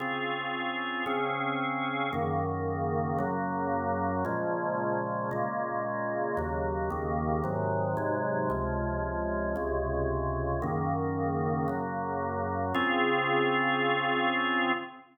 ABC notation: X:1
M:4/4
L:1/8
Q:1/4=113
K:Db
V:1 name="Drawbar Organ"
[D,CFA]4 [D,CDA]4 | [G,,D,E,B,]4 [G,,D,G,B,]4 | [B,,D,F,A,]4 [B,,D,A,B,]4 | [E,,D,G,B,]2 [E,,D,E,B,]2 [A,,C,E,G,]2 [A,,C,G,A,]2 |
[D,,C,F,A,]4 [D,,C,D,A,]4 | [G,,D,E,B,]4 [G,,D,G,B,]4 | [D,CFA]8 |]